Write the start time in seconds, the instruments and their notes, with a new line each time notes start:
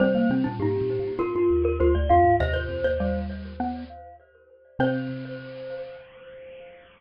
0.00 xylophone C3 G3 C4, glockenspiel C5
0.15 xylophone A#3
0.30 xylophone C3 C4
0.44 xylophone A#2 D4
0.59 xylophone G#2 D#4, glockenspiel G4
0.81 xylophone A#2
0.99 xylophone A#2
1.19 xylophone A#2 F4, glockenspiel A#4
1.35 xylophone G2 F4
1.50 xylophone D#2
1.65 glockenspiel A#4
1.80 xylophone D2 F4, glockenspiel C5
1.95 xylophone D2, glockenspiel D5
2.09 xylophone F2 F4, glockenspiel F5
2.24 xylophone G#2
2.40 xylophone D#2 C3 D#5, glockenspiel C5
2.54 xylophone C5
2.69 xylophone F2
2.84 xylophone D#2 C5
3.00 xylophone G3
3.60 xylophone B3
4.79 xylophone C3 C4 C5, glockenspiel C5